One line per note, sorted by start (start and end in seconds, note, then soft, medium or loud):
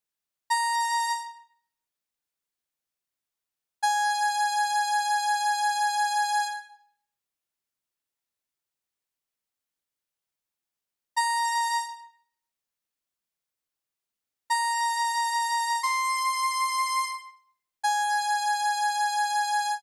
0.50 1.11 A#5 medium
3.83 6.44 G#5 medium
11.17 11.78 A#5 medium
14.50 15.76 A#5 medium
15.83 17.04 C6 medium
17.83 19.74 G#5 medium